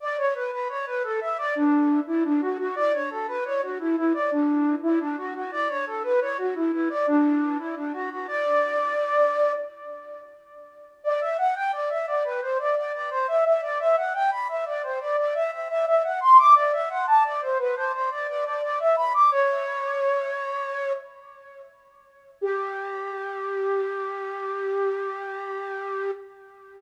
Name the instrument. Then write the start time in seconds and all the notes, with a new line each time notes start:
flute
0.00 D5
0.17 C#5
0.35 B4
0.52 B4
0.69 C#5
0.86 B4
1.03 A4
1.21 E5
1.38 D5
1.55 D4
2.07 E4
2.24 D4
2.41 F#4
2.59 F#4
2.76 D5
2.93 C#5
3.10 A4
3.28 B4
3.45 C#5
3.62 F#4
3.79 E4
3.96 E4
4.14 D5
4.31 D4
4.83 E4
5.00 D4
5.17 F#4
5.34 F#4
5.52 D5
5.69 C#5
5.86 A4
6.03 B4
6.21 C#5
6.38 F#4
6.55 E4
6.72 E4
6.90 D5
7.07 D4
7.58 E4
7.76 D4
7.93 F#4
8.10 F#4
8.27 D5
11.04 D5
11.21 E5
11.38 F#5
11.55 G5
11.72 D5
11.90 E5
12.07 D5
12.24 B4
12.41 C5
12.59 D5
12.76 D5
12.93 D5
13.10 C5
13.28 E5
13.45 E5
13.62 D5
13.79 E5
13.97 F#5
14.14 G5
14.31 B5
14.48 E5
14.66 D5
14.83 C5
15.00 D5
15.17 D5
15.34 E5
15.52 E5
15.69 E5
15.86 E5
16.04 F#5
16.21 C6
16.38 D6
16.55 D5
16.73 E5
16.90 F#5
17.07 A5
17.24 D5
17.42 C5
17.59 B4
17.76 C5
17.93 C5
18.10 D5
18.28 D5
18.45 D5
18.62 D5
18.79 E5
18.97 B5
19.14 D6
19.31 C#5
22.41 G4